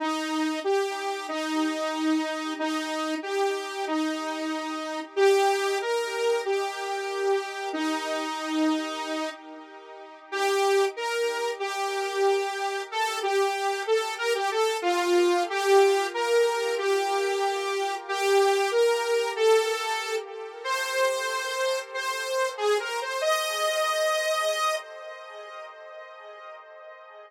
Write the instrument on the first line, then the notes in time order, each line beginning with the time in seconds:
lead 2 (sawtooth)
0.00 D#4
0.64 G4
1.28 D#4
2.59 D#4
3.23 G4
3.87 D#4
5.16 G4
5.81 A#4
6.45 G4
7.73 D#4
10.32 G4
10.96 A#4
11.60 G4
12.92 A4
13.22 G4
13.87 A4
14.18 A#4
14.35 G4
14.51 A4
14.82 F4
15.50 G4
16.14 A#4
16.78 G4
18.08 G4
18.71 A#4
19.36 A4
20.64 C5
21.94 C5
22.57 G#4
22.80 A#4
23.02 C5
23.21 D#5